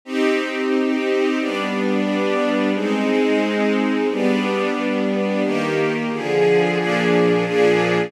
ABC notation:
X:1
M:2/4
L:1/8
Q:1/4=89
K:Cm
V:1 name="String Ensemble 1"
[CEG]4 | [G,=B,D]4 | [A,CE]4 | [G,=B,D]4 |
[K:Eb] [E,B,G]2 [D,F,A]2 | [B,,F,DA]2 [B,,F,DA]2 |]